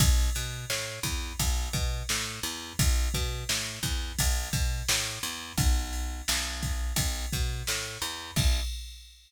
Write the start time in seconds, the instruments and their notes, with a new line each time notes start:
0.00 electric bass (finger) B1, kick, ride
0.35 electric bass (finger) B2, ride
0.70 electric bass (finger) A2, snare
1.03 electric bass (finger) E2, kick, ride
1.39 electric bass (finger) B1, kick, ride
1.73 electric bass (finger) B2, kick, ride
2.09 electric bass (finger) A2, snare
2.43 electric bass (finger) E2, ride
2.79 electric bass (finger) B1, kick, ride
3.14 electric bass (finger) B2, kick, ride
3.49 electric bass (finger) A2, snare
3.83 electric bass (finger) E2, kick, ride
4.19 electric bass (finger) B1, kick, ride
4.53 electric bass (finger) B2, kick, ride
4.89 electric bass (finger) A2, snare
5.23 electric bass (finger) E2, ride
5.58 electric bass (finger) B1, kick, ride
5.93 ride
6.28 electric bass (finger) B1, snare
6.62 kick, ride
6.96 electric bass (finger) B1, kick, ride
7.32 electric bass (finger) B2, kick, ride
7.67 electric bass (finger) A2, snare
8.02 electric bass (finger) E2, ride
8.36 electric bass (finger) B1, kick, crash